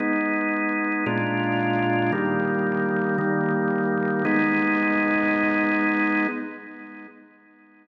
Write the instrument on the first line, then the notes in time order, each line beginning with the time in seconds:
drawbar organ
0.00 G#3 B3 D#4
1.06 A#2 G#3 D4 F4
2.12 D#3 G3 A#3
3.18 D#3 G3 A#3
4.25 G#3 B3 D#4